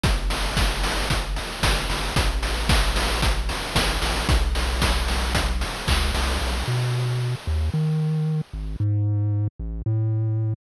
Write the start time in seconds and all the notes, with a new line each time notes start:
0.03 G1, kick, closed hi-hat
0.30 snare, open hi-hat
0.57 kick, snare
0.83 open hi-hat
1.10 kick, closed hi-hat
1.36 open hi-hat
1.63 G1, kick, snare
1.90 G1, open hi-hat
2.16 A1, kick, closed hi-hat
2.42 snare, open hi-hat
2.69 kick, snare
2.96 open hi-hat
3.22 kick, closed hi-hat
3.49 open hi-hat
3.75 A1, kick, snare
4.02 A1, open hi-hat
4.29 B1, kick, closed hi-hat
4.55 snare, open hi-hat
4.82 kick, snare
5.08 open hi-hat
5.35 kick, closed hi-hat
5.61 open hi-hat
5.88 C#2, kick, clap
6.14 C2, open hi-hat
6.41 B1
6.67 B2
7.47 D#2
7.74 D#3
8.53 G#1
8.80 G#2
9.59 A1
9.86 A2